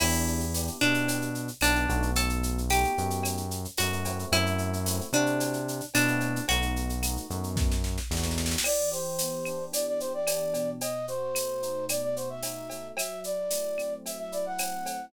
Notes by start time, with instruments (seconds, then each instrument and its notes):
0.00 synth bass 1 E2, electric piano 1 B3 D4 E4 G4, acoustic guitar (steel) E4, crash, cowbell, claves
0.13 shaker
0.27 shaker
0.40 shaker
0.54 electric piano 1 B3 D4 E4 G4, tambourine, shaker
0.67 shaker
0.81 synth bass 1 B2, electric piano 1 B3 D4 E4 G4, acoustic guitar (steel) D4, claves, shaker
0.94 shaker
1.08 cowbell, shaker
1.22 shaker
1.35 shaker
1.48 shaker
1.61 synth bass 1 B1, electric piano 1 B3 D4 E4 G4, acoustic guitar (steel) D4, tambourine, cowbell, claves, shaker
1.75 electric piano 1 B3 D4 E4 G4, shaker
1.89 synth bass 1 B1, electric piano 1 A3 B3 D#4 F#4, cowbell, shaker
2.02 shaker
2.15 acoustic guitar (steel) A4, cowbell, shaker
2.29 shaker
2.43 shaker
2.58 shaker
2.70 electric piano 1 A3 B3 D#4 F#4, acoustic guitar (steel) G4, tambourine, claves, shaker
2.84 shaker
2.98 synth bass 1 F#2, electric piano 1 A3 B3 D#4 F#4, shaker
3.10 shaker
3.23 cowbell, claves, shaker
3.37 shaker
3.51 shaker
3.65 shaker
3.77 synth bass 1 F#2, electric piano 1 A3 B3 D#4 F#4, acoustic guitar (steel) F#4, tambourine, cowbell, shaker
3.92 electric piano 1 A3 B3 D#4 F#4, shaker
4.05 electric piano 1 A3 C4 E4 F#4, cowbell, shaker
4.19 shaker
4.32 synth bass 1 F#2, acoustic guitar (steel) E4, cowbell, claves, shaker
4.46 shaker
4.58 shaker
4.73 shaker
4.86 electric piano 1 A3 C4 E4 F#4, tambourine, shaker
5.01 shaker
5.12 synth bass 1 C3, electric piano 1 A3 C4 E4 F#4, acoustic guitar (steel) D4, claves, shaker
5.26 shaker
5.40 cowbell, shaker
5.53 shaker
5.68 shaker
5.80 shaker
5.94 synth bass 1 B2, electric piano 1 A3 C4 E4 F#4, acoustic guitar (steel) D4, tambourine, cowbell, claves, shaker
6.08 electric piano 1 A3 C4 E4 F#4, shaker
6.20 cowbell, shaker
6.36 shaker
6.48 synth bass 1 B1, electric piano 1 A3 B3 D#4 F#4, acoustic guitar (steel) F#4, cowbell, shaker
6.62 shaker
6.76 shaker
6.89 shaker
7.02 electric piano 1 A3 B3 D#4 F#4, tambourine, claves, shaker
7.17 shaker
7.30 synth bass 1 F#2, electric piano 1 A3 B3 D#4 F#4, shaker
7.44 shaker
7.56 kick, snare
7.72 snare
7.84 snare
7.98 snare
8.10 synth bass 1 E2, electric piano 1 A3 B3 D#4 F#4, snare
8.17 snare
8.23 electric piano 1 A3 B3 D#4 F#4, snare
8.31 snare
8.38 snare
8.46 snare
8.51 snare
8.58 snare
8.64 electric piano 1 E3, flute D5, crash, cowbell, claves
8.92 electric piano 1 G4, flute C5, shaker
9.18 electric piano 1 B3, tambourine, shaker
9.45 electric piano 1 D4, claves, shaker
9.72 electric piano 1 E3, flute D5, cowbell, shaker
9.87 flute D5
10.00 electric piano 1 G4, flute C5, shaker
10.14 flute D5
10.27 electric piano 1 D4, tambourine, cowbell, claves, shaker
10.53 electric piano 1 B2, cowbell, shaker
10.81 flute D#5, cowbell, shaker
11.08 electric piano 1 F#4, flute C5, shaker
11.35 electric piano 1 A3, tambourine, claves, shaker
11.63 electric piano 1 D#4, shaker
11.89 electric piano 1 B2, flute D5, cowbell, claves, shaker
12.02 flute D5
12.16 electric piano 1 F#4, flute C5, shaker
12.30 flute E5
12.43 electric piano 1 D#4, tambourine, cowbell, shaker
12.70 electric piano 1 A3, cowbell, shaker
12.97 electric piano 1 F#3, flute E5, cowbell, claves, shaker
13.24 electric piano 1 E4, flute D5, shaker
13.50 electric piano 1 A3, tambourine, shaker
13.78 electric piano 1 C4, claves, shaker
14.06 electric piano 1 F#3, flute E5, cowbell, shaker
14.19 flute E5
14.32 electric piano 1 E4, flute D5, shaker
14.46 flute F#5
14.58 electric piano 1 C4, tambourine, cowbell, claves, shaker
14.85 electric piano 1 A3, cowbell, shaker